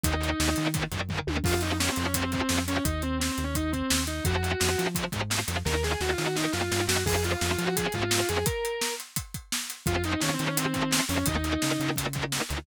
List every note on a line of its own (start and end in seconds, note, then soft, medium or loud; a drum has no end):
0.04 0.34 D#2 medium
0.04 0.11 A#2 medium
0.04 0.11 D#3 medium
0.04 0.67 D#4 loud
0.04 kick medium
0.04 closed hi-hat medium
0.21 0.28 A#2 medium
0.21 0.28 D#3 medium
0.21 closed hi-hat medium
0.40 0.55 D#2 medium
0.40 0.47 A#2 medium
0.40 0.47 D#3 medium
0.40 snare medium
0.56 0.65 A#2 medium
0.56 0.87 D#3 medium
0.56 0.65 D#3 medium
0.56 closed hi-hat medium
0.74 0.81 A#2 medium
0.74 0.81 D#3 medium
0.74 kick medium
0.74 closed hi-hat medium
0.92 1.21 F#2 medium
0.92 0.99 A#2 medium
0.92 0.99 D#3 medium
0.92 kick medium
0.92 closed hi-hat medium
1.09 1.17 A#2 medium
1.09 1.17 D#3 medium
1.09 kick medium
1.09 floor tom medium
1.27 1.42 D#2 medium
1.27 1.35 A#2 medium
1.27 1.35 D#3 medium
1.27 high tom medium
1.44 1.89 F2 medium
1.44 1.51 C3 medium
1.44 1.51 F3 medium
1.44 1.61 F4 loud
1.44 kick medium
1.44 crash medium
1.61 1.70 C3 medium
1.61 1.70 F3 medium
1.61 1.76 D#4 medium
1.61 closed hi-hat medium
1.80 1.87 C3 medium
1.80 1.87 F3 medium
1.80 1.91 C#4 medium
1.80 snare medium
1.92 2.03 C4 medium
1.96 2.42 F2 medium
1.96 2.04 C3 medium
1.96 2.04 F3 medium
1.96 closed hi-hat medium
2.04 2.15 C#4 medium
2.14 2.22 C3 medium
2.14 2.22 F3 medium
2.14 2.31 C4 medium
2.14 kick medium
2.14 closed hi-hat medium
2.32 2.39 C3 medium
2.32 2.39 F3 medium
2.32 2.61 C4 medium
2.32 kick medium
2.32 closed hi-hat medium
2.49 2.80 F2 medium
2.49 2.57 C3 medium
2.49 2.57 F3 medium
2.49 snare medium
2.68 2.75 C3 medium
2.68 2.75 F3 medium
2.68 2.83 C#4 medium
2.68 closed hi-hat medium
2.84 3.30 D#2 medium
2.84 3.01 D#4 loud
2.84 kick medium
2.84 closed hi-hat medium
3.02 3.17 C4 medium
3.02 closed hi-hat soft
3.20 3.31 C4 medium
3.20 snare medium
3.32 3.43 C4 medium
3.38 3.83 D#2 medium
3.38 closed hi-hat medium
3.44 3.55 C#4 medium
3.55 3.71 D#4 medium
3.55 kick medium
3.55 closed hi-hat medium
3.72 4.02 C4 medium
3.72 kick medium
3.72 closed hi-hat soft
3.90 4.21 D#2 medium
3.90 snare loud
4.07 4.23 D#4 medium
4.07 closed hi-hat medium
4.25 4.55 F2 medium
4.25 4.34 C3 medium
4.25 4.34 F3 medium
4.25 4.85 F#4 loud
4.25 kick medium
4.25 closed hi-hat medium
4.43 4.50 C3 medium
4.43 4.50 F3 medium
4.43 closed hi-hat medium
4.60 4.76 F2 medium
4.60 4.67 C3 medium
4.60 4.67 F3 medium
4.60 snare medium
4.78 4.85 C3 medium
4.78 4.85 F3 medium
4.78 5.08 F3 medium
4.78 closed hi-hat medium
4.95 5.02 C3 medium
4.95 5.02 F3 medium
4.95 kick medium
4.95 closed hi-hat medium
5.12 5.43 G#2 medium
5.12 5.19 C3 medium
5.12 5.19 F3 medium
5.12 kick medium
5.12 closed hi-hat medium
5.30 5.37 C3 medium
5.30 5.37 F3 medium
5.30 snare medium
5.48 5.63 F2 medium
5.48 5.55 C3 medium
5.48 5.55 F3 medium
5.48 closed hi-hat medium
5.65 5.96 D#2 medium
5.65 5.72 A#2 medium
5.65 5.72 D#3 medium
5.65 5.81 A#4 loud
5.65 kick medium
5.65 snare medium
5.83 5.90 A#2 medium
5.83 5.90 D#3 medium
5.83 6.00 G#4 medium
5.83 snare medium
6.00 6.15 D#2 medium
6.00 6.08 A#2 medium
6.00 6.08 D#3 medium
6.00 6.12 F#4 medium
6.00 snare medium
6.12 6.24 F4 medium
6.18 6.25 A#2 medium
6.18 6.25 D#3 medium
6.18 6.48 D#3 medium
6.18 snare medium
6.24 6.36 F#4 medium
6.36 6.43 A#2 medium
6.36 6.43 D#3 medium
6.36 6.52 D#4 medium
6.36 snare medium
6.52 6.70 F#2 medium
6.52 6.60 A#2 medium
6.52 6.60 D#3 medium
6.52 6.83 F4 medium
6.52 snare medium
6.71 6.87 G2 medium
6.71 6.79 A#2 medium
6.71 6.79 D#3 medium
6.71 snare medium
6.87 7.04 F#2 medium
6.87 6.94 A#2 medium
6.87 6.94 D#3 medium
6.87 7.03 F#4 medium
6.87 snare loud
7.06 7.36 F2 medium
7.06 7.13 C3 medium
7.06 7.13 F3 medium
7.06 7.23 G#4 medium
7.06 kick medium
7.06 crash medium
7.23 7.30 C3 medium
7.23 7.30 F3 medium
7.23 7.39 F4 medium
7.23 closed hi-hat medium
7.41 7.56 F2 medium
7.41 7.49 C3 medium
7.41 7.49 F3 medium
7.41 7.52 F4 medium
7.41 snare medium
7.53 7.64 F4 medium
7.58 7.66 C3 medium
7.58 7.88 F3 medium
7.58 7.66 F3 medium
7.58 closed hi-hat medium
7.64 7.75 F#4 medium
7.76 7.85 C3 medium
7.76 7.85 F3 medium
7.76 7.93 G#4 medium
7.76 kick medium
7.76 closed hi-hat medium
7.92 8.24 G#2 medium
7.92 8.01 C3 medium
7.92 8.01 F3 medium
7.92 8.27 F4 medium
7.92 kick medium
7.92 closed hi-hat medium
8.11 8.18 C3 medium
8.11 8.18 F3 medium
8.11 snare loud
8.28 8.44 F2 medium
8.28 8.36 C3 medium
8.28 8.36 F3 medium
8.28 8.45 G#4 medium
8.28 closed hi-hat medium
8.46 8.93 A#4 loud
8.46 kick medium
8.46 closed hi-hat medium
8.65 closed hi-hat medium
8.81 snare medium
9.00 closed hi-hat medium
9.16 kick medium
9.16 closed hi-hat medium
9.34 kick medium
9.34 closed hi-hat medium
9.52 snare medium
9.70 closed hi-hat medium
9.86 10.16 F2 medium
9.86 9.94 C3 medium
9.86 9.94 F3 medium
9.86 10.02 F4 medium
9.86 kick medium
9.86 closed hi-hat medium
10.04 10.11 C3 medium
10.04 10.11 F3 medium
10.04 10.20 D#4 medium
10.04 closed hi-hat medium
10.20 10.27 C3 medium
10.20 10.37 D#3 medium
10.20 10.27 F3 medium
10.20 10.33 C#4 medium
10.20 snare medium
10.34 10.45 C4 medium
10.39 10.46 C3 medium
10.39 10.99 D#3 medium
10.39 10.46 F3 medium
10.39 closed hi-hat medium
10.46 10.57 C#4 medium
10.57 10.64 C3 medium
10.57 10.64 F3 medium
10.57 10.73 C4 loud
10.57 closed hi-hat medium
10.74 10.81 C3 medium
10.74 10.81 F3 medium
10.74 11.02 C4 medium
10.74 kick medium
10.74 closed hi-hat medium
10.91 10.98 C3 medium
10.91 10.98 F3 medium
10.91 snare loud
11.09 11.24 F2 medium
11.09 11.16 C3 medium
11.09 11.16 F3 medium
11.09 11.25 C#4 medium
11.09 open hi-hat medium
11.26 11.57 D#2 medium
11.26 11.34 A#2 medium
11.26 11.34 D#3 medium
11.26 11.91 D#4 loud
11.26 kick medium
11.26 closed hi-hat medium
11.44 11.51 A#2 medium
11.44 11.51 D#3 medium
11.44 closed hi-hat medium
11.62 11.70 A#2 medium
11.62 11.78 C#3 medium
11.62 11.70 D#3 medium
11.62 snare medium
11.80 11.88 A#2 medium
11.80 12.39 C#3 medium
11.80 11.88 D#3 medium
11.80 closed hi-hat soft
11.96 12.04 A#2 medium
11.96 12.04 D#3 medium
11.96 kick medium
11.96 closed hi-hat medium
12.13 12.22 A#2 medium
12.13 12.22 D#3 medium
12.13 kick medium
12.13 closed hi-hat medium
12.32 12.39 A#2 medium
12.32 12.39 D#3 medium
12.32 snare medium
12.49 12.65 D2 medium
12.49 12.56 A#2 medium
12.49 12.56 D#3 medium
12.49 closed hi-hat medium